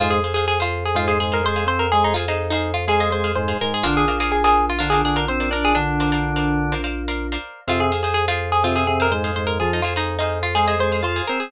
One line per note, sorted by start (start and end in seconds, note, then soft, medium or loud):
0.00 3.53 F2 medium
0.00 0.20 G#2 medium
0.00 0.20 G#3 loud
0.00 0.11 F4 medium
0.00 0.19 G#4 medium
0.00 0.19 C5 medium
0.00 0.19 F5 medium
0.10 0.33 G#4 medium
0.24 0.34 G#4 medium
0.24 0.34 C5 medium
0.24 0.34 F5 medium
0.34 0.46 G#4 medium
0.34 0.55 G#4 medium
0.34 0.55 C5 medium
0.34 0.55 F5 medium
0.48 0.59 G#4 medium
0.60 0.84 F4 medium
0.60 0.89 G#4 medium
0.60 0.89 C5 medium
0.60 0.89 F5 medium
0.85 0.97 G#4 medium
0.95 1.18 G#2 medium
0.95 1.18 G#3 medium
0.95 1.08 F4 medium
0.95 1.05 G#4 medium
0.95 1.05 C5 medium
0.95 1.05 F5 medium
1.08 1.19 G#4 medium
1.08 1.27 G#4 medium
1.08 1.27 C5 medium
1.08 1.27 F5 medium
1.20 1.41 G#2 medium
1.20 1.41 G#3 medium
1.20 1.32 G#4 medium
1.32 1.51 G#4 medium
1.32 1.45 A#4 medium
1.32 1.51 C5 medium
1.32 1.51 F5 medium
1.44 1.65 G#3 medium
1.44 1.65 G#4 medium
1.44 1.67 C5 medium
1.56 1.94 G#4 medium
1.56 1.94 C5 medium
1.56 1.94 F5 medium
1.66 1.86 C4 medium
1.66 1.86 C5 medium
1.66 1.79 C5 medium
1.79 1.91 A#4 medium
1.92 2.13 G#3 medium
1.92 2.03 G#4 medium
1.92 2.13 G#4 loud
2.04 2.16 D#4 medium
2.14 2.25 F4 medium
2.14 2.26 G#4 medium
2.14 2.26 C5 medium
2.14 2.26 F5 medium
2.28 2.50 D#4 medium
2.28 2.47 G#4 medium
2.28 2.47 C5 medium
2.28 2.47 F5 medium
2.50 2.72 D#4 medium
2.50 2.81 G#4 medium
2.50 2.81 C5 medium
2.50 2.81 F5 medium
2.74 2.85 F4 medium
2.88 3.09 G#3 medium
2.88 3.09 G#4 medium
2.88 2.98 G#4 medium
2.88 3.00 G#4 medium
2.88 2.98 C5 medium
2.88 2.98 F5 medium
3.00 3.19 G#4 medium
3.00 3.19 C5 medium
3.00 3.12 D#5 medium
3.00 3.19 F5 medium
3.10 3.32 G#3 medium
3.10 3.32 G#4 medium
3.10 3.32 C5 medium
3.24 3.43 G#4 medium
3.24 3.43 C5 medium
3.24 3.43 F5 medium
3.35 3.57 G#2 medium
3.35 3.57 G#3 medium
3.35 3.58 C5 medium
3.48 3.77 G#4 medium
3.48 3.77 C5 medium
3.48 3.77 F5 medium
3.61 3.83 G#2 medium
3.61 3.83 G#3 medium
3.61 3.73 A#4 medium
3.74 3.85 G#4 medium
3.83 7.37 A#1 medium
3.83 4.05 D3 medium
3.83 4.05 D4 loud
3.83 3.95 F4 medium
3.83 4.03 A#4 medium
3.83 4.03 C5 medium
3.83 4.03 D5 medium
3.83 4.03 F5 loud
3.97 4.19 G#4 medium
4.08 4.17 A#4 medium
4.08 4.17 C5 medium
4.08 4.17 D5 medium
4.08 4.17 F5 medium
4.20 4.31 G#4 medium
4.20 4.39 A#4 medium
4.20 4.39 C5 medium
4.20 4.39 D5 medium
4.20 4.39 F5 medium
4.32 4.43 G#4 medium
4.44 4.66 G#4 medium
4.44 4.73 A#4 medium
4.44 4.73 C5 medium
4.44 4.73 D5 medium
4.44 4.73 F5 medium
4.70 4.78 F4 medium
4.79 5.03 D3 medium
4.79 5.03 D4 medium
4.79 4.90 F4 medium
4.79 4.90 A#4 medium
4.79 4.90 C5 medium
4.79 4.90 D5 medium
4.79 4.90 F5 medium
4.90 5.01 G#4 medium
4.90 5.11 A#4 medium
4.90 5.11 C5 medium
4.90 5.11 D5 medium
4.90 5.11 F5 medium
5.05 5.26 D3 medium
5.05 5.26 D4 medium
5.05 5.16 G#4 medium
5.16 5.35 A#4 medium
5.16 5.28 A#4 medium
5.16 5.35 C5 medium
5.16 5.35 D5 medium
5.16 5.35 F5 medium
5.28 5.49 C4 medium
5.28 5.48 C5 medium
5.28 5.49 C5 loud
5.40 5.79 A#4 medium
5.40 5.79 C5 medium
5.40 5.79 D5 medium
5.40 5.79 F5 medium
5.51 5.73 D4 medium
5.51 5.64 A#4 medium
5.51 5.73 D5 loud
5.65 5.76 G#4 medium
5.75 6.74 D3 loud
5.75 6.94 D4 medium
5.75 6.74 D4 loud
6.00 6.10 A#4 medium
6.00 6.10 C5 medium
6.00 6.10 D5 medium
6.00 6.10 F5 medium
6.12 6.31 A#4 medium
6.12 6.31 C5 medium
6.12 6.31 D5 medium
6.12 6.31 F5 medium
6.36 6.65 A#4 medium
6.36 6.65 C5 medium
6.36 6.65 D5 medium
6.36 6.65 F5 medium
6.72 6.82 A#4 medium
6.72 6.82 C5 medium
6.72 6.82 D5 medium
6.72 6.82 F5 medium
6.84 7.03 A#4 medium
6.84 7.03 C5 medium
6.84 7.03 D5 medium
6.84 7.03 F5 medium
7.08 7.27 A#4 medium
7.08 7.27 C5 medium
7.08 7.27 D5 medium
7.08 7.27 F5 medium
7.32 7.61 A#4 medium
7.32 7.61 C5 medium
7.32 7.61 D5 medium
7.32 7.61 F5 medium
7.67 11.21 F2 medium
7.67 7.91 C3 medium
7.67 7.91 C4 loud
7.67 7.81 F4 medium
7.67 7.87 G#4 medium
7.67 7.87 C5 medium
7.67 7.87 F5 loud
7.80 8.01 G#4 medium
7.92 8.02 G#4 medium
7.92 8.02 C5 medium
7.92 8.02 F5 medium
8.03 8.14 G#4 medium
8.03 8.23 G#4 medium
8.03 8.23 C5 medium
8.03 8.23 F5 medium
8.14 8.26 G#4 medium
8.28 8.50 F4 medium
8.28 8.57 G#4 medium
8.28 8.57 C5 medium
8.28 8.57 F5 medium
8.52 8.63 G#4 medium
8.64 8.84 C3 medium
8.64 8.84 C4 loud
8.64 8.76 F4 medium
8.64 8.74 G#4 medium
8.64 8.74 C5 medium
8.64 8.74 F5 medium
8.76 8.87 G#4 medium
8.76 8.95 G#4 medium
8.76 8.95 C5 medium
8.76 8.95 F5 medium
8.87 9.07 C3 medium
8.87 9.07 C4 medium
8.87 8.99 G#4 medium
9.00 9.19 G#4 medium
9.00 9.13 A#4 medium
9.00 9.19 C5 medium
9.00 9.19 F5 medium
9.11 9.31 G#2 medium
9.11 9.31 G#3 medium
9.11 9.35 C5 medium
9.24 9.62 G#4 medium
9.24 9.62 C5 medium
9.24 9.62 F5 medium
9.36 9.59 G#2 medium
9.36 9.59 G#3 medium
9.36 9.47 C5 medium
9.47 9.58 A#4 medium
9.60 9.81 F3 medium
9.60 9.81 F4 loud
9.60 9.71 G#4 medium
9.73 9.85 D#4 medium
9.82 9.94 F4 medium
9.82 9.94 G#4 medium
9.82 9.94 C5 medium
9.82 9.94 F5 medium
9.96 10.17 D#4 medium
9.96 10.15 G#4 medium
9.96 10.15 C5 medium
9.96 10.15 F5 medium
10.19 10.39 D#4 medium
10.19 10.49 G#4 medium
10.19 10.49 C5 medium
10.19 10.49 F5 medium
10.43 10.54 F4 medium
10.55 10.75 G#3 medium
10.55 10.66 G#4 medium
10.55 10.75 G#4 medium
10.55 10.66 G#4 medium
10.55 10.66 C5 medium
10.55 10.66 F5 medium
10.68 10.87 G#4 medium
10.68 10.87 C5 medium
10.68 10.79 D#5 medium
10.68 10.87 F5 medium
10.79 11.02 G#3 medium
10.79 11.02 G#4 medium
10.79 11.01 C5 medium
10.92 11.11 G#4 medium
10.92 11.11 C5 medium
10.92 11.11 F5 medium
11.03 11.22 F4 medium
11.03 11.26 C5 medium
11.03 11.22 F5 loud
11.16 11.45 G#4 medium
11.16 11.45 C5 medium
11.16 11.45 F5 medium
11.27 11.51 C4 medium
11.27 11.39 A#4 medium
11.27 11.51 C5 loud
11.40 11.51 G#4 medium